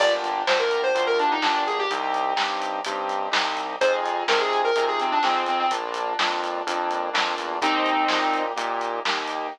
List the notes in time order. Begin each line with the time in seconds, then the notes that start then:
0.00 G1 A#3 D4 F4 G4 D5, kick, crash
0.24 closed hi-hat
0.47 D2 A#3 D4 F4 G4 C5, snare
0.59 A#4
0.71 closed hi-hat
0.83 C5
0.95 D2 A#3 D4 F4 G4, kick, closed hi-hat
1.07 A#4
1.19 D4, closed hi-hat
1.31 D#4
1.42 G1 A#3 D4 F4 G4, snare
1.67 G#4, closed hi-hat
1.79 G4
1.90 C2 C4 D#4 G4, kick, closed hi-hat
2.14 closed hi-hat
2.36 G2 C4 D#4 G4, snare
2.62 closed hi-hat
2.85 G2 C4 D#4 G4, kick, closed hi-hat
3.09 kick, closed hi-hat
3.32 C2 C4 D#4 G4, snare
3.57 closed hi-hat
3.81 F2 C4 D#4 F4 G#4 C5, kick, closed hi-hat
4.06 closed hi-hat
4.28 C3 C4 D#4 F4 G#4 A#4, snare
4.40 G#4
4.53 closed hi-hat
4.64 A#4
4.76 C3 C4 D#4 F4 G#4, kick, closed hi-hat
4.88 G#4
5.00 C4, closed hi-hat
5.12 D4
5.23 F2 C4 D#4 F4 G#4, snare
5.46 C4, closed hi-hat
5.59 C4
5.71 A#1 A#3 D4 F4, kick, closed hi-hat
5.94 closed hi-hat
6.19 F2 A#3 D4 F4, snare
6.44 closed hi-hat
6.67 F2 A#3 D4 F4, kick, closed hi-hat
6.90 kick, closed hi-hat
7.13 F2 A#3 D4 F4, snare
7.38 E2, closed hi-hat
7.62 D#2 A#3 C4 D#4 G4, kick, closed hi-hat
7.86 closed hi-hat
8.08 A#2 A#3 D#4 G4, snare
8.33 closed hi-hat
8.56 A#2 A#3 D#4 G4, kick, closed hi-hat
8.81 closed hi-hat
9.05 D#2 A#3 D#4 G4, snare
9.27 closed hi-hat